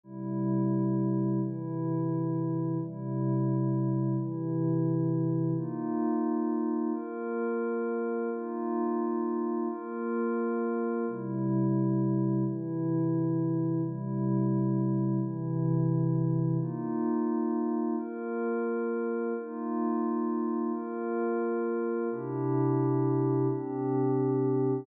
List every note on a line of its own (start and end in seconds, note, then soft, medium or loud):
0.03 1.40 C3 medium
0.03 1.40 G3 medium
0.03 1.40 E4 medium
1.41 2.78 C3 medium
1.41 2.78 E3 medium
1.41 2.78 E4 medium
2.80 4.16 C3 medium
2.80 4.16 G3 medium
2.80 4.16 E4 medium
4.17 5.54 C3 medium
4.17 5.54 E3 medium
4.17 5.54 E4 medium
5.55 6.92 A#3 medium
5.55 6.92 D#4 medium
5.55 6.92 F4 medium
6.93 8.30 A#3 medium
6.93 8.30 F4 medium
6.93 8.30 A#4 medium
8.31 9.68 A#3 medium
8.31 9.68 D#4 medium
8.31 9.68 F4 medium
9.69 11.06 A#3 medium
9.69 11.06 F4 medium
9.69 11.06 A#4 medium
11.07 12.44 C3 medium
11.07 12.44 G3 medium
11.07 12.44 E4 medium
12.45 13.81 C3 medium
12.45 13.81 E3 medium
12.45 13.81 E4 medium
13.83 15.20 C3 medium
13.83 15.20 G3 medium
13.83 15.20 E4 medium
15.21 16.58 C3 medium
15.21 16.58 E3 medium
15.21 16.58 E4 medium
16.59 17.95 A#3 medium
16.59 17.95 D#4 medium
16.59 17.95 F4 medium
17.97 19.33 A#3 medium
17.97 19.33 F4 medium
17.97 19.33 A#4 medium
19.35 20.72 A#3 medium
19.35 20.72 D#4 medium
19.35 20.72 F4 medium
20.72 22.09 A#3 medium
20.72 22.09 F4 medium
20.72 22.09 A#4 medium
22.11 23.47 C3 medium
22.11 23.47 D4 medium
22.11 23.47 E4 medium
22.11 23.47 G4 medium
23.48 24.85 C3 medium
23.48 24.85 C4 medium
23.48 24.85 D4 medium
23.48 24.85 G4 medium